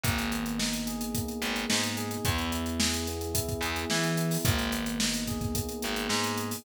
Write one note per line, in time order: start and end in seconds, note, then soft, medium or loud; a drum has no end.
0.04 1.21 G#1 loud
0.04 1.16 A#3 loud
0.04 kick loud
0.04 closed hi-hat loud
0.18 closed hi-hat medium
0.32 1.41 B3 medium
0.32 closed hi-hat medium
0.46 closed hi-hat medium
0.58 1.69 D#4 medium
0.58 snare loud
0.73 closed hi-hat medium
0.86 1.97 G#4 medium
0.86 closed hi-hat medium
1.01 closed hi-hat loud
1.15 2.21 A#3 medium
1.15 kick loud
1.15 closed hi-hat loud
1.28 closed hi-hat medium
1.42 1.65 G#1 medium
1.42 2.20 B3 medium
1.42 closed hi-hat medium
1.56 closed hi-hat medium
1.70 2.17 G#2 medium
1.70 2.22 D#4 loud
1.70 snare loud
1.83 closed hi-hat medium
1.97 2.23 G#4 medium
1.97 closed hi-hat medium
2.11 closed hi-hat medium
2.25 3.42 E2 loud
2.25 3.07 B3 loud
2.25 kick loud
2.25 closed hi-hat loud
2.38 closed hi-hat medium
2.52 3.34 E4 medium
2.52 closed hi-hat loud
2.66 closed hi-hat medium
2.79 3.62 G#4 medium
2.79 snare loud
2.94 closed hi-hat medium
3.07 3.90 B3 medium
3.07 closed hi-hat medium
3.21 closed hi-hat medium
3.34 4.18 E4 medium
3.34 kick loud
3.34 closed hi-hat loud
3.49 kick loud
3.49 closed hi-hat medium
3.61 3.84 E2 loud
3.61 4.41 G#4 medium
3.61 closed hi-hat medium
3.76 closed hi-hat medium
3.90 4.37 E3 medium
3.90 4.43 B3 medium
3.90 snare loud
4.04 closed hi-hat medium
4.17 4.44 E4 medium
4.17 closed hi-hat loud
4.31 open hi-hat medium
4.44 5.62 G#1 loud
4.44 5.54 A#3 loud
4.44 kick loud
4.44 closed hi-hat loud
4.59 closed hi-hat medium
4.72 5.81 B3 medium
4.72 closed hi-hat loud
4.86 closed hi-hat medium
5.00 6.09 D#4 medium
5.00 snare loud
5.14 closed hi-hat medium
5.27 6.38 G#4 medium
5.27 kick medium
5.27 closed hi-hat medium
5.41 kick loud
5.41 closed hi-hat medium
5.55 6.60 A#3 medium
5.55 kick loud
5.55 closed hi-hat loud
5.69 closed hi-hat medium
5.82 6.07 G#1 medium
5.82 6.60 B3 medium
5.82 closed hi-hat loud
5.96 closed hi-hat medium
6.09 6.56 G#2 medium
6.09 6.62 D#4 medium
6.09 snare loud
6.24 closed hi-hat medium
6.38 6.64 G#4 medium
6.38 closed hi-hat medium
6.51 open hi-hat medium